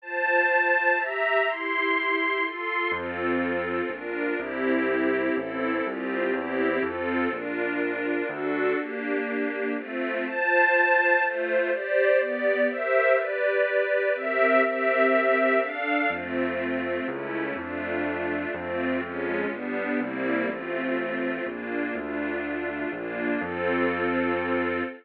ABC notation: X:1
M:3/4
L:1/8
Q:1/4=123
K:F
V:1 name="String Ensemble 1"
[Fca]4 [Geb]2 | [EGc']4 [FAc']2 | [CFA]4 [DFB]2 | [CEG]4 [CEA]2 |
[CFG]2 [CEG]2 [CFA]2 | [DFB]4 [D^FA]2 | [B,DG]4 [A,CF]2 | [Fca]4 [A,Fc]2 |
[Gcd]2 [=B,Gd]2 [G_Bce]2 | [G=Bd]4 [CG_Be]2 | [CGBe]4 [DAf]2 | [A,CF]4 [A,^CE]2 |
[A,DF]4 [A,CF]2 | [_A,_DF]2 [G,=B,=D]2 [G,_B,CE]2 | [A,CF]4 [B,DF]2 | [A,DF]4 [B,DF]2 |
[CFA]6 |]
V:2 name="Acoustic Grand Piano" clef=bass
z6 | z6 | F,,4 B,,,2 | C,,4 A,,,2 |
C,,2 E,,2 F,,2 | B,,,4 D,,2 | z6 | z6 |
z6 | z6 | z6 | F,,4 ^C,,2 |
F,,4 F,,2 | F,,2 G,,,2 C,,2 | A,,,4 B,,,2 | D,,4 B,,,2 |
F,,6 |]